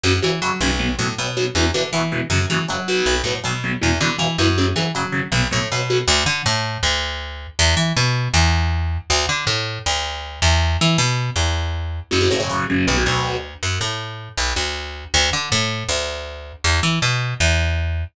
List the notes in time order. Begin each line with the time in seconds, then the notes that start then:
0.03 F#2 C#3 F#3
0.22 C#3 E3 F#3
0.42 C#3 F#3
0.61 B1 C#3 F#3
0.79 B2 F#3
0.99 A2 B2 F#3
1.18 B2 F#3
1.37 B2 F#3
1.55 E2 B2 E3
1.74 B2 D3 E3
1.93 B2 E3
2.12 B2 E3
2.30 F#2 C#3 F#3
2.50 C#3 E3 F#3
2.68 C#3 F#3
2.88 B2 F#3
3.06 B1
3.24 A2 B2 F#3
3.44 B2 F#3
3.64 B2 F#3
3.82 E2 B2 E3
4.00 B2 D3 E3
4.18 B2 E3
4.38 F#2 B2 E3
4.58 C#3 F#3
4.76 C#3 E3 F#3
4.95 C#3 F#3
5.12 C#3 F#3
5.32 B1 B2 F#3
5.51 A2 B2 F#3
5.72 B2 F#3
5.90 B2 F#3
6.08 D2
6.26 D3
6.46 A2
6.83 D2
7.59 E2
7.77 E3
7.97 B2
8.34 E2
9.10 D2
9.29 D3
9.47 A2
9.86 D2
10.42 E2
10.81 E3
10.98 B2
11.36 E2
12.11 F#2 C#3 F#3
12.21 C#3 F#3
12.31 A2 C#3 F#3
12.40 C#3 F#3
12.49 C#3 F#3
12.70 C#3 F#3
12.87 B1 B2 F#3
12.97 B2 F#3
13.05 D2 B2 F#3
13.63 F#2
13.81 A2
14.37 B1
14.56 D2
15.14 D2
15.33 D3
15.52 A2
15.89 D2
16.64 E2
16.83 E3
17.02 B2
17.40 E2